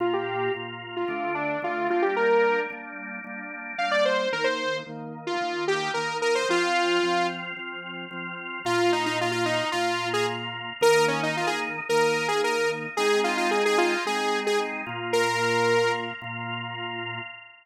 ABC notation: X:1
M:4/4
L:1/16
Q:1/4=111
K:Bb
V:1 name="Lead 2 (sawtooth)"
F G3 z3 F3 D2 F2 F G | B4 z8 f d c2 | B c3 z3 F3 G2 B2 B c | F6 z10 |
[K:Bbm] F2 E E F F E2 F3 A z4 | B2 D E F A z2 B3 A B2 z2 | A2 F F A A F2 A3 A z4 | B6 z10 |]
V:2 name="Drawbar Organ"
[B,,B,F]4 [B,,B,F]4 [D,A,D]4 [D,A,D]2 [G,B,D]2- | [G,B,D]4 [G,B,D]4 [G,B,D]4 [G,B,D]4 | [E,B,E]4 [E,B,E]4 [E,B,E]4 [E,B,E]4 | [F,CF]4 [F,CF]4 [F,CF]4 [F,CF]4 |
[K:Bbm] [B,,B,F]8 [B,,B,F]8 | [E,B,E]8 [E,B,E]8 | [A,CE]8 [A,CE]6 [B,,B,F]2- | [B,,B,F]8 [B,,B,F]8 |]